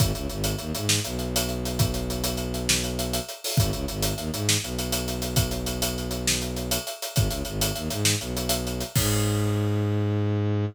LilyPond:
<<
  \new Staff \with { instrumentName = "Violin" } { \clef bass \time 12/8 \key gis \minor \tempo 4. = 134 gis,,8 cis,8 gis,,4 dis,8 gis,4 b,,2~ b,,8~ | b,,1. | gis,,8 cis,8 gis,,4 dis,8 gis,4 b,,2~ b,,8~ | b,,1. |
gis,,8 cis,8 gis,,4 dis,8 gis,4 b,,2~ b,,8 | gis,1. | }
  \new DrumStaff \with { instrumentName = "Drums" } \drummode { \time 12/8 <hh bd>8 hh8 hh8 hh8 hh8 hh8 sn8 hh8 hh8 hh8 hh8 hh8 | <hh bd>8 hh8 hh8 hh8 hh8 hh8 sn8 hh8 hh8 hh8 hh8 hho8 | <hh bd>8 hh8 hh8 hh8 hh8 hh8 sn8 hh8 hh8 hh8 hh8 hh8 | <hh bd>8 hh8 hh8 hh8 hh8 hh8 sn8 hh8 hh8 hh8 hh8 hh8 |
<hh bd>8 hh8 hh8 hh8 hh8 hh8 sn8 hh8 hh8 hh8 hh8 hh8 | <cymc bd>4. r4. r4. r4. | }
>>